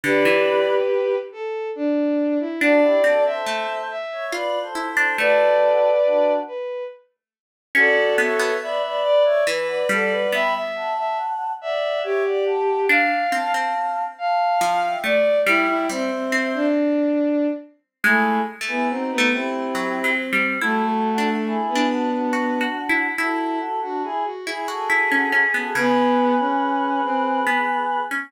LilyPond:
<<
  \new Staff \with { instrumentName = "Choir Aahs" } { \time 3/4 \key g \mixolydian \tempo 4 = 70 <b' d''>4 r2 | <d' fis'>16 <e' g'>16 <fis' a'>16 <a' c''>8. r16 <cis'' e''>16 \tuplet 3/2 { <b' d''>8 <a' c''>8 <a' c''>8 } | <fis' a'>4 <d' fis'>8 r4. | \key d \mixolydian <d'' fis''>8 <cis'' e''>8 <b' d''>16 <b' d''>8 <cis'' e''>16 r16 <d'' fis''>16 <d'' fis''>8 |
<g'' b''>16 r16 <fis'' a''>4 <d'' fis''>8 <cis'' e''>16 <d'' fis''>16 <fis'' a''>8 | r8 <f'' a''>4 <f'' a''>8. <e'' g''>16 r8 | <e'' g''>8 <c'' e''>4 r4. | \key a \mixolydian <e' gis'>8 r16 <e' gis'>16 <dis' fis'>8 <e' g'>4 r8 |
<fis' a'>4 <e' gis'>8 <d' fis'>16 <d' fis'>4~ <d' fis'>16 | <fis' a'>8 <fis' a'>16 <d' fis'>16 <e' gis'>16 r16 <e' gis'>16 <fis' a'>4 <fis' a'>16 | <gis' b'>2. | }
  \new Staff \with { instrumentName = "Violin" } { \time 3/4 \key g \mixolydian <g' b'>4. a'8 d'8. e'16 | d''8. e''8. e''8 r4 | <b' d''>4. b'8 r4 | \key d \mixolydian <fis' a'>4 e''8 d''8 b'16 b'16 a'16 b'16 |
e''16 e''8 e''16 r8 e''8 g'4 | f''8. r8. f''4 d''8 | e'16 e'16 c'16 c'8 d'4~ d'16 r8 | \key a \mixolydian a8 r16 b16 c'16 b16 c'4. |
a16 a4 b4~ b16 r8 | e'8 r16 fis'16 gis'16 fis'16 gis'4. | b8. cis'8. c'8 r4 | }
  \new Staff \with { instrumentName = "Pizzicato Strings" } { \time 3/4 \key g \mixolydian d16 e4~ e16 r4. | d'8 c'8 a16 r8. f'8 e'16 d'16 | a4. r4. | \key d \mixolydian cis'8 b16 b16 r4 e8 g8 |
b2. | d'8 c'16 c'16 r4 f8 a8 | g8 g16 r16 c'4 r4 | \key a \mixolydian \tuplet 3/2 { gis4 a4 a4 fis8 fis8 g8 } |
\tuplet 3/2 { e'4 d'4 d'4 fis'8 fis'8 e'8 } | e'4. e'16 fis'16 e'16 cis'16 cis'16 b16 | cis2 b8. cis'16 | }
>>